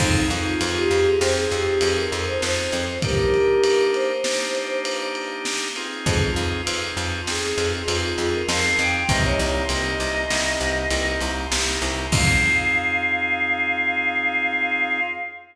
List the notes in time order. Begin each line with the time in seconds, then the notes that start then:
0.00 F2 C4 D#4 F4 G#4, kick, crash
0.30 F2 D#4, ride
0.46 F4
0.61 F2, ride
0.76 G4
0.91 F2, ride
1.06 G#4
1.21 F2 C4 D#4 F4 G#4 C5, snare
1.36 G#4
1.51 F2 G4, ride
1.81 F2 G#4, ride
1.97 A#4
2.12 F2, ride
2.27 C5
2.42 F2 C5, snare
2.72 F2, ride
3.02 A#3 D4 D#4 G4 A#4, kick, ride
3.34 ride
3.64 ride
3.94 C5, ride
4.24 A#3 D4 D#4 G4, snare
4.55 ride
4.85 ride
5.15 ride
5.45 snare
5.76 C4 D#4 F4 G#4, ride
6.06 F2 G#4, kick, ride
6.36 F2, ride
6.66 F2 C4 D#4 F4 G#4, ride
6.97 F2, ride
7.27 F2 C4 D#4 F4 G#4, snare
7.43 G#4
7.58 F2, ride
7.72 G#4
7.88 F2 C4 D#4 F4 G#4, ride
8.18 F2 G#4, ride
8.33 A#4
8.48 F2 C4 D#4 F4 G#4 F5, snare
8.79 F2 G5, ride
8.94 G5
9.09 C2 A#3 C4 D#4 G4 D#5, kick, ride
9.24 C#5
9.39 C2, ride
9.69 C2 A#3 C4 D#4 G4 D#5, ride
10.00 C2, ride
10.30 C2 A#3 C4 D#4 G4, snare
10.61 C2, ride
10.91 C2 A#3 C4 D#4 G4, ride
11.21 C2, ride
11.51 C2 A#3 C4 D#4 G4, snare
11.82 C2, ride
12.12 F2 C4 D#4 F4 G#4 F5, kick, crash